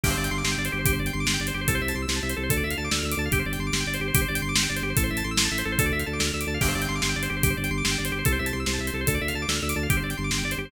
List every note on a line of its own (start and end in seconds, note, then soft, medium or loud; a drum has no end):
0.03 0.15 G1 loud
0.03 0.10 G4 medium
0.03 kick medium
0.03 crash medium
0.10 0.16 C5 medium
0.17 0.29 G1 loud
0.17 0.23 D5 medium
0.24 0.30 G5 medium
0.24 closed hi-hat medium
0.31 0.43 G1 loud
0.31 0.37 C6 medium
0.38 0.44 D6 medium
0.44 0.56 G1 loud
0.44 0.51 C6 medium
0.44 snare medium
0.51 0.58 G5 medium
0.58 0.69 G1 loud
0.58 0.64 D5 medium
0.65 0.71 C5 medium
0.65 closed hi-hat medium
0.72 0.85 G1 loud
0.72 0.78 G4 medium
0.79 0.85 C5 medium
0.85 0.98 G1 loud
0.85 0.92 G4 loud
0.85 kick medium
0.85 closed hi-hat medium
0.93 0.99 C5 medium
0.99 1.11 G1 loud
0.99 1.06 D5 medium
1.06 1.12 G5 medium
1.06 closed hi-hat medium
1.13 1.26 G1 loud
1.13 1.19 C6 medium
1.20 1.26 D6 medium
1.26 1.38 G1 loud
1.26 1.33 C6 medium
1.26 snare loud
1.34 1.40 G5 medium
1.40 1.52 G1 loud
1.40 1.47 D5 medium
1.47 1.53 C5 medium
1.47 closed hi-hat medium
1.54 1.66 G1 medium
1.54 1.60 G4 medium
1.61 1.67 C5 medium
1.68 1.80 C2 loud
1.68 1.74 A4 medium
1.68 kick medium
1.68 closed hi-hat medium
1.75 1.81 C5 medium
1.81 1.93 C2 loud
1.81 1.88 E5 medium
1.88 1.95 A5 medium
1.88 closed hi-hat medium
1.94 2.06 C2 loud
1.94 2.01 C6 medium
2.02 2.08 E6 medium
2.08 2.20 C2 loud
2.08 2.15 C6 medium
2.08 snare medium
2.16 2.22 A5 medium
2.23 2.34 C2 loud
2.23 2.29 E5 medium
2.30 2.36 C5 medium
2.30 closed hi-hat medium
2.36 2.49 C2 loud
2.36 2.43 A4 medium
2.43 2.49 C5 medium
2.50 2.63 D2 loud
2.50 2.56 A4 medium
2.50 kick medium
2.50 closed hi-hat medium
2.57 2.63 D5 medium
2.63 2.75 D2 medium
2.63 2.70 E5 medium
2.70 2.77 F5 medium
2.70 closed hi-hat medium
2.77 2.89 D2 medium
2.77 2.84 A5 medium
2.84 2.90 D6 medium
2.91 3.03 D2 medium
2.91 2.97 E6 medium
2.91 snare medium
2.98 3.04 F6 medium
3.03 3.15 D2 loud
3.03 3.11 E6 medium
3.12 3.18 D6 medium
3.12 closed hi-hat medium
3.17 3.29 D2 loud
3.17 3.25 A5 medium
3.25 3.32 F5 medium
3.31 3.43 G1 loud
3.31 3.38 G4 loud
3.31 kick medium
3.31 closed hi-hat medium
3.39 3.45 C5 medium
3.46 3.57 G1 loud
3.46 3.52 D5 medium
3.53 3.59 G5 medium
3.53 closed hi-hat medium
3.59 3.71 G1 loud
3.59 3.66 C6 medium
3.66 3.73 D6 medium
3.72 3.84 G1 loud
3.72 3.80 C6 medium
3.72 snare medium
3.80 3.86 G5 medium
3.86 3.98 G1 medium
3.86 3.93 D5 medium
3.94 4.00 C5 medium
3.94 closed hi-hat medium
4.00 4.12 G1 medium
4.00 4.07 G4 medium
4.08 4.14 C5 medium
4.14 4.26 G1 loud
4.14 4.21 G4 loud
4.14 kick medium
4.14 closed hi-hat loud
4.21 4.27 C5 medium
4.28 4.41 G1 loud
4.28 4.34 D5 medium
4.35 4.41 G5 medium
4.35 closed hi-hat medium
4.42 4.54 G1 loud
4.42 4.48 C6 medium
4.49 4.55 D6 medium
4.55 4.67 G1 medium
4.55 4.62 C6 medium
4.55 snare loud
4.62 4.69 G5 medium
4.69 4.82 G1 medium
4.69 4.75 D5 medium
4.76 4.82 C5 medium
4.76 closed hi-hat medium
4.82 4.94 G1 loud
4.82 4.89 G4 medium
4.90 4.96 C5 medium
4.97 5.10 A1 loud
4.97 5.03 A4 medium
4.97 kick medium
4.97 closed hi-hat medium
5.03 5.10 C5 medium
5.10 5.23 A1 loud
5.10 5.16 E5 medium
5.17 5.23 A5 medium
5.17 closed hi-hat medium
5.24 5.36 A1 loud
5.24 5.30 C6 medium
5.31 5.37 E6 medium
5.37 5.48 A1 loud
5.37 5.44 C6 medium
5.37 snare loud
5.45 5.51 A5 medium
5.51 5.63 A1 medium
5.51 5.58 E5 medium
5.58 5.64 C5 medium
5.58 closed hi-hat medium
5.65 5.77 A1 loud
5.65 5.71 A4 medium
5.72 5.78 C5 medium
5.79 5.91 D2 loud
5.79 5.85 A4 loud
5.79 kick medium
5.79 closed hi-hat medium
5.86 5.92 D5 medium
5.92 6.04 D2 loud
5.92 5.99 E5 medium
5.99 6.06 F5 medium
5.99 closed hi-hat medium
6.06 6.19 D2 loud
6.06 6.12 A5 medium
6.13 6.19 D6 medium
6.19 6.31 D2 loud
6.19 6.26 E6 medium
6.19 snare medium
6.27 6.33 F6 medium
6.34 6.45 D2 medium
6.34 6.40 E6 medium
6.40 6.47 D6 medium
6.40 closed hi-hat medium
6.47 6.58 D2 loud
6.47 6.53 A5 medium
6.54 6.60 F5 medium
6.61 6.74 G1 loud
6.61 6.67 G4 medium
6.61 kick medium
6.61 crash medium
6.68 6.74 C5 medium
6.75 6.87 G1 loud
6.75 6.81 D5 medium
6.82 6.88 G5 medium
6.82 closed hi-hat medium
6.88 7.01 G1 loud
6.88 6.95 C6 medium
6.95 7.01 D6 medium
7.02 7.15 G1 loud
7.02 7.08 C6 medium
7.02 snare medium
7.09 7.15 G5 medium
7.16 7.28 G1 loud
7.16 7.22 D5 medium
7.23 7.29 C5 medium
7.23 closed hi-hat medium
7.30 7.42 G1 loud
7.30 7.36 G4 medium
7.36 7.43 C5 medium
7.43 7.55 G1 loud
7.43 7.49 G4 loud
7.43 kick medium
7.43 closed hi-hat medium
7.50 7.56 C5 medium
7.57 7.70 G1 loud
7.57 7.63 D5 medium
7.64 7.70 G5 medium
7.64 closed hi-hat medium
7.71 7.82 G1 loud
7.71 7.77 C6 medium
7.77 7.84 D6 medium
7.84 7.96 G1 loud
7.84 7.90 C6 medium
7.84 snare loud
7.91 7.97 G5 medium
7.98 8.11 G1 loud
7.98 8.04 D5 medium
8.05 8.11 C5 medium
8.05 closed hi-hat medium
8.12 8.23 G1 medium
8.12 8.18 G4 medium
8.19 8.25 C5 medium
8.25 8.38 C2 loud
8.25 8.32 A4 medium
8.25 kick medium
8.25 closed hi-hat medium
8.32 8.38 C5 medium
8.39 8.52 C2 loud
8.39 8.45 E5 medium
8.46 8.52 A5 medium
8.46 closed hi-hat medium
8.53 8.65 C2 loud
8.53 8.59 C6 medium
8.60 8.66 E6 medium
8.66 8.78 C2 loud
8.66 8.73 C6 medium
8.66 snare medium
8.73 8.80 A5 medium
8.79 8.90 C2 loud
8.79 8.86 E5 medium
8.87 8.93 C5 medium
8.87 closed hi-hat medium
8.93 9.05 C2 loud
8.93 9.00 A4 medium
9.01 9.07 C5 medium
9.07 9.18 D2 loud
9.07 9.14 A4 medium
9.07 kick medium
9.07 closed hi-hat medium
9.14 9.21 D5 medium
9.21 9.33 D2 medium
9.21 9.27 E5 medium
9.28 9.34 F5 medium
9.28 closed hi-hat medium
9.34 9.46 D2 medium
9.34 9.41 A5 medium
9.42 9.48 D6 medium
9.48 9.60 D2 medium
9.48 9.55 E6 medium
9.48 snare medium
9.56 9.62 F6 medium
9.62 9.74 D2 loud
9.62 9.69 E6 medium
9.69 9.75 D6 medium
9.69 closed hi-hat medium
9.76 9.87 D2 loud
9.76 9.82 A5 medium
9.83 9.89 F5 medium
9.90 10.01 G1 loud
9.90 9.96 G4 loud
9.90 kick medium
9.90 closed hi-hat medium
9.97 10.03 C5 medium
10.03 10.14 G1 loud
10.03 10.10 D5 medium
10.10 10.16 G5 medium
10.10 closed hi-hat medium
10.17 10.30 G1 loud
10.17 10.23 C6 medium
10.24 10.30 D6 medium
10.31 10.43 G1 loud
10.31 10.37 C6 medium
10.31 snare medium
10.38 10.44 G5 medium
10.43 10.55 G1 medium
10.43 10.51 D5 medium
10.51 10.58 C5 medium
10.51 closed hi-hat medium
10.57 10.69 G1 medium
10.57 10.64 G4 medium
10.65 10.71 C5 medium